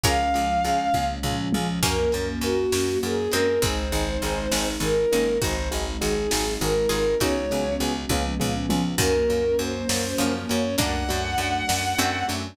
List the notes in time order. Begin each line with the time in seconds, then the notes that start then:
0.03 C#2 F3 G#3 C#4 F4 G#4 A#4 C#5 F5, kick, closed hi-hat
0.34 C#2 C#4 F4 G#4, closed hi-hat
0.64 C#2 C#4 F4 G#4, closed hi-hat
0.94 C#2 C#4 F4 G#4, kick, high tom
1.23 C#2 C#4 F4 G#4, floor tom
1.52 C#2 C#4 F4 G#4, mid tom
1.83 F#2 F#3 A#3 C#4 F#4 A#4, kick, crash
2.12 F#2 C#4 F#4 A#4, closed hi-hat
2.41 F#2 C#4 F#4 A#4, closed hi-hat
2.72 F#2 C#4 F#4 A#4, snare
3.03 F#2 C#4 F#4 G#4 A#4, closed hi-hat
3.32 F#2 G#3 C4 C#4 F#4 A#4, closed hi-hat
3.62 G#1 G#3 C4 D#4 G#4 C5, kick, closed hi-hat
3.92 G#1 C4 D#4 G#4, closed hi-hat
4.22 G#1 C4 D#4 G#4, closed hi-hat
4.51 G#1 C4 D#4 G#4, snare
4.80 G#1 C4 D#4 G#4 A#4, closed hi-hat
5.12 G#1 A#3 C4 C#4 D#4 G#4, closed hi-hat
5.42 G#1 F#3 G#3 C4 D#4 F#4 G#4 C5, kick, closed hi-hat
5.71 G#1 C4 D#4 F#4 G#4, closed hi-hat
6.01 G#1 C4 D#4 F#4 G#4, closed hi-hat
6.31 G#1 C4 D#4 F#4 G#4, snare
6.61 G#1 C4 D#4 F#4 G#4 A#4, closed hi-hat
6.89 G#1 C4 D#4 F4 F#4 G#4 A#4, closed hi-hat
7.20 C#2 F#3 G#3 B3 C#4 D#4 F#4 G#4 C#5, kick, closed hi-hat
7.51 C#2 B3 C#4 F#4 G#4, closed hi-hat
7.80 C#2 B3 C#4 F#4 G#4, closed hi-hat
8.09 C#2 F3 G#3 B3 C#4 F4 G#4, kick, high tom
8.40 C#2 B3 C#4 F4 G#4, floor tom
8.69 C#2 B3 C#4 F4 G#4, mid tom
8.98 F#2 D#3 F#3 A#3 C#4 F#4 A#4, kick, crash
9.29 F#2 A#3 C#4 F#4, closed hi-hat
9.59 F#2 A#3 C#4 F#4 C5, closed hi-hat
9.89 F#2 A#3 C#4 F#4, snare
10.18 F#2 C#3 F3 A#3 C#4 F#4, closed hi-hat
10.49 F#2 A#3 C#4 F#4 C#5, closed hi-hat
10.77 F#2 F#3 A3 A#3 D4 F#4 F#5, kick, closed hi-hat
11.08 F#2 A3 D4 F#4, closed hi-hat
11.38 F#2 A3 D4 F#4, closed hi-hat
11.68 F#2 A3 D4 F#4, snare
11.98 F#2 A3 C4 D4 F#4, closed hi-hat
12.28 F#2 A3 D4 F#4, closed hi-hat